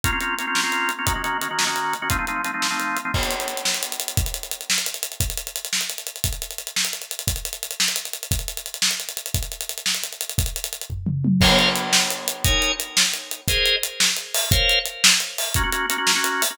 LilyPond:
<<
  \new Staff \with { instrumentName = "Drawbar Organ" } { \time 6/8 \key bes \minor \tempo 4. = 116 <bes c' des' f'>16 <bes c' des' f'>16 <bes c' des' f'>8 <bes c' des' f'>16 <bes c' des' f'>8 <bes c' des' f'>4 <bes c' des' f'>16 | <ees bes des' ges'>16 <ees bes des' ges'>16 <ees bes des' ges'>8 <ees bes des' ges'>16 <ees bes des' ges'>8 <ees bes des' ges'>4 <ees bes des' ges'>16 | <f a c' ees'>16 <f a c' ees'>16 <f a c' ees'>8 <f a c' ees'>16 <f a c' ees'>8 <f a c' ees'>4 <f a c' ees'>16 | \key b \minor r2. |
r2. | r2. | r2. | r2. |
r2. | r2. | r2. | \key bes \minor <bes' c'' des'' f''>2. |
<ees' bes' des'' aes''>2. | <aes' bes' c'' ees''>2. | <bes' c'' des'' f''>2. | <bes des' ges'>16 <bes des' ges'>16 <bes des' ges'>8 <bes des' ges'>16 <bes des' ges'>8 <bes des' ges'>4 <bes des' ges'>16 | }
  \new DrumStaff \with { instrumentName = "Drums" } \drummode { \time 6/8 <hh bd>8 hh8 hh8 sn8 hh8 hh8 | <hh bd>8 hh8 hh8 sn8 hh8 hh8 | <hh bd>8 hh8 hh8 sn8 hh8 hh8 | <cymc bd>16 hh16 hh16 hh16 hh16 hh16 sn16 hh16 hh16 hh16 hh16 hh16 |
<hh bd>16 hh16 hh16 hh16 hh16 hh16 sn16 hh16 hh16 hh16 hh16 hh16 | <hh bd>16 hh16 hh16 hh16 hh16 hh16 sn16 hh16 hh16 hh16 hh16 hh16 | <hh bd>16 hh16 hh16 hh16 hh16 hh16 sn16 hh16 hh16 hh16 hh16 hh16 | <hh bd>16 hh16 hh16 hh16 hh16 hh16 sn16 hh16 hh16 hh16 hh16 hh16 |
<hh bd>16 hh16 hh16 hh16 hh16 hh16 sn16 hh16 hh16 hh16 hh16 hh16 | <hh bd>16 hh16 hh16 hh16 hh16 hh16 sn16 hh16 hh16 hh16 hh16 hh16 | <hh bd>16 hh16 hh16 hh16 hh16 hh16 <bd tomfh>8 toml8 tommh8 | <cymc bd>8 hh8 hh8 sn8 hh8 hh8 |
<hh bd>8 hh8 hh8 sn8 hh8 hh8 | <hh bd>8 hh8 hh8 sn8 hh8 hho8 | <hh bd>8 hh8 hh8 sn8 hh8 hho8 | <hh bd>8 hh8 hh8 sn8 hh8 hho8 | }
>>